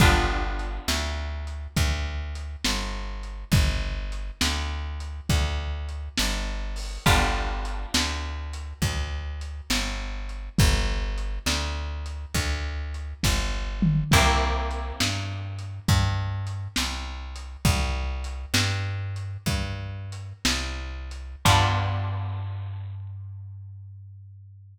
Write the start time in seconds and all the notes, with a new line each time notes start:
0.00 G1 B3 D4 F4 G4, kick, closed hi-hat
0.59 closed hi-hat
0.88 D2, snare
1.47 closed hi-hat
1.76 D2, kick, closed hi-hat
2.35 closed hi-hat
2.64 G1, snare
3.23 closed hi-hat
3.52 G1, kick, closed hi-hat
4.12 closed hi-hat
4.41 D2, snare
5.00 closed hi-hat
5.29 D2, kick, closed hi-hat
5.89 closed hi-hat
6.18 G1, snare
6.76 open hi-hat
7.06 G1 B3 D4 F4 G4, kick, closed hi-hat
7.65 closed hi-hat
7.94 D2, snare
8.53 closed hi-hat
8.82 D2, kick, closed hi-hat
9.41 closed hi-hat
9.70 G1, snare
10.29 closed hi-hat
10.58 G1, kick, closed hi-hat
11.18 closed hi-hat
11.46 D2, snare
12.06 closed hi-hat
12.34 D2, kick, closed hi-hat
12.94 closed hi-hat
13.23 G1, kick, snare
13.82 mid tom
14.11 C2 A#3 C4 E4 G4, kick, crash
14.71 closed hi-hat
15.00 G2, snare
15.59 closed hi-hat
15.88 G2, kick, closed hi-hat
16.47 closed hi-hat
16.76 C2, snare
17.36 closed hi-hat
17.65 C2, kick, closed hi-hat
18.24 closed hi-hat
18.54 G2, snare
19.16 closed hi-hat
19.46 G2, kick, closed hi-hat
20.12 closed hi-hat
20.45 C2, snare
21.11 closed hi-hat
21.45 G2 B3 D4 F4 G4, kick, crash